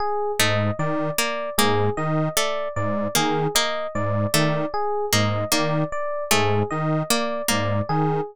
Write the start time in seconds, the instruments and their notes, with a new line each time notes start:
0.00 electric piano 1 G#4
0.39 lead 1 (square) G#2, harpsichord A3, electric piano 1 D#5
0.79 lead 1 (square) D#3, electric piano 1 D5
1.18 harpsichord A#3, electric piano 1 D5
1.58 lead 1 (square) G#2, harpsichord A#3, electric piano 1 G#4
1.97 lead 1 (square) D#3, electric piano 1 D#5
2.37 harpsichord A3, electric piano 1 D5
2.76 lead 1 (square) G#2, electric piano 1 D5
3.15 lead 1 (square) D#3, harpsichord A#3, electric piano 1 G#4
3.55 harpsichord A#3, electric piano 1 D#5
3.95 lead 1 (square) G#2, electric piano 1 D5
4.34 lead 1 (square) D#3, harpsichord A3, electric piano 1 D5
4.74 electric piano 1 G#4
5.13 lead 1 (square) G#2, harpsichord A#3, electric piano 1 D#5
5.52 lead 1 (square) D#3, harpsichord A#3, electric piano 1 D5
5.92 electric piano 1 D5
6.31 lead 1 (square) G#2, harpsichord A3, electric piano 1 G#4
6.71 lead 1 (square) D#3, electric piano 1 D#5
7.10 harpsichord A#3, electric piano 1 D5
7.48 lead 1 (square) G#2, harpsichord A#3, electric piano 1 D5
7.89 lead 1 (square) D#3, electric piano 1 G#4